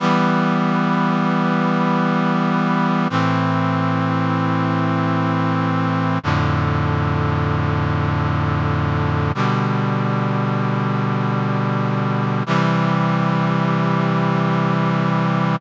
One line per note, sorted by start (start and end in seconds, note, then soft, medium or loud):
0.00 3.08 E3 loud
0.00 3.08 G3 loud
0.00 3.08 B3 loud
3.10 6.19 A2 medium
3.10 6.19 E3 loud
3.10 6.19 C4 loud
6.23 9.32 F2 loud
6.23 9.32 A2 loud
6.23 9.32 D3 loud
9.35 12.43 B2 loud
9.35 12.43 D3 medium
9.35 12.43 G3 medium
12.46 15.56 C3 medium
12.46 15.56 E3 loud
12.46 15.56 G3 loud